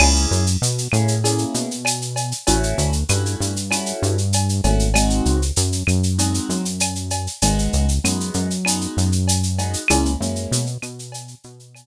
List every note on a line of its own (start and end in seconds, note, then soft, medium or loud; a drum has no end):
0.00 0.27 C#2 loud
0.00 0.43 A#3 loud
0.00 0.43 C#4 loud
0.00 0.43 E4 loud
0.00 0.43 G#4 loud
0.00 crash medium
0.00 cowbell medium
0.00 claves loud
0.15 shaker medium
0.31 0.57 F#2 loud
0.31 shaker medium
0.47 shaker medium
0.62 0.88 B2 medium
0.62 shaker medium
0.78 shaker medium
0.92 1.45 A2 medium
0.92 1.14 A#3 loud
0.92 1.14 C#4 medium
0.92 1.14 E4 medium
0.92 1.14 G#4 medium
0.92 claves medium
0.92 shaker medium
1.08 shaker medium
1.24 1.67 A#3 medium
1.24 1.67 C#4 medium
1.24 1.67 E4 medium
1.24 1.67 G#4 medium
1.24 cowbell medium
1.24 shaker medium
1.38 shaker medium
1.54 2.33 B2 medium
1.54 shaker medium
1.71 shaker medium
1.85 cowbell medium
1.85 claves medium
1.85 shaker loud
2.01 shaker medium
2.16 cowbell medium
2.16 shaker medium
2.32 shaker medium
2.47 2.74 A1 loud
2.47 2.90 A3 loud
2.47 2.90 C#4 loud
2.47 2.90 E4 loud
2.47 2.90 F#4 loud
2.47 cowbell medium
2.47 shaker loud
2.63 shaker medium
2.78 3.04 D2 loud
2.78 shaker medium
2.93 shaker medium
3.09 3.36 G2 loud
3.09 3.52 A3 medium
3.09 3.52 C#4 medium
3.09 3.52 E4 loud
3.09 3.52 F#4 loud
3.09 claves medium
3.09 shaker medium
3.26 shaker medium
3.40 3.93 G2 medium
3.40 shaker medium
3.56 shaker medium
3.71 4.15 A3 medium
3.71 4.15 C#4 medium
3.71 4.15 E4 loud
3.71 4.15 F#4 medium
3.71 cowbell medium
3.71 claves medium
3.71 shaker medium
3.86 shaker medium
4.02 4.61 G2 loud
4.02 shaker medium
4.18 shaker medium
4.33 cowbell medium
4.33 shaker loud
4.49 shaker medium
4.64 5.21 G#1 loud
4.64 4.86 A3 medium
4.64 4.86 C#4 medium
4.64 4.86 E4 medium
4.64 4.86 F#4 loud
4.64 cowbell medium
4.64 shaker medium
4.79 shaker medium
4.94 5.38 G#3 loud
4.94 5.38 C4 loud
4.94 5.38 D#4 loud
4.94 5.38 F#4 loud
4.94 cowbell medium
4.94 claves loud
4.94 shaker loud
5.10 shaker medium
5.25 5.52 C#2 medium
5.25 shaker medium
5.42 shaker medium
5.56 5.83 F#2 loud
5.56 shaker loud
5.72 shaker medium
5.87 6.40 F#2 medium
5.87 claves medium
5.87 shaker medium
6.03 shaker medium
6.18 6.62 G#3 medium
6.18 6.62 C4 medium
6.18 6.62 D#4 medium
6.18 6.62 F#4 loud
6.18 cowbell medium
6.18 shaker medium
6.34 shaker medium
6.49 7.28 F#2 medium
6.49 shaker medium
6.65 shaker medium
6.80 cowbell medium
6.80 claves medium
6.80 shaker loud
6.95 shaker medium
7.10 cowbell medium
7.10 shaker medium
7.27 shaker medium
7.42 7.69 G#1 loud
7.42 7.86 G#3 loud
7.42 7.86 B3 loud
7.42 7.86 D#4 loud
7.42 7.86 F#4 loud
7.42 cowbell medium
7.42 shaker loud
7.59 shaker medium
7.73 7.99 C#2 medium
7.73 shaker medium
7.89 shaker medium
8.04 8.31 F#2 medium
8.04 8.47 G#3 loud
8.04 8.47 B3 loud
8.04 8.47 D#4 medium
8.04 8.47 F#4 medium
8.04 claves medium
8.04 shaker loud
8.20 shaker medium
8.34 8.87 F#2 loud
8.34 shaker medium
8.50 shaker medium
8.65 9.09 G#3 medium
8.65 9.09 B3 medium
8.65 9.09 D#4 loud
8.65 9.09 F#4 medium
8.65 cowbell medium
8.65 claves medium
8.65 shaker loud
8.81 shaker medium
8.97 9.76 F#2 medium
8.97 shaker medium
9.12 shaker medium
9.28 cowbell medium
9.28 shaker loud
9.43 shaker medium
9.59 9.80 G#3 medium
9.59 9.80 B3 loud
9.59 9.80 D#4 medium
9.59 9.80 F#4 medium
9.59 cowbell medium
9.59 shaker medium
9.73 shaker medium
9.88 10.16 C#2 loud
9.88 10.12 G#3 loud
9.88 10.12 A#3 loud
9.88 10.12 C#4 loud
9.88 10.12 E4 loud
9.88 cowbell loud
9.88 claves loud
9.88 shaker loud
10.05 shaker medium
10.20 10.47 F#2 medium
10.20 10.64 G#3 medium
10.20 10.64 A#3 loud
10.20 10.64 C#4 medium
10.20 10.64 E4 medium
10.20 shaker medium
10.36 shaker medium
10.51 10.78 B2 loud
10.51 shaker loud
10.66 shaker medium
10.82 11.35 B2 medium
10.82 claves medium
10.82 shaker medium
10.99 shaker medium
11.12 cowbell medium
11.12 shaker loud
11.28 shaker medium
11.44 11.86 B2 medium
11.44 shaker medium
11.59 shaker medium
11.75 cowbell medium
11.75 claves medium
11.75 shaker medium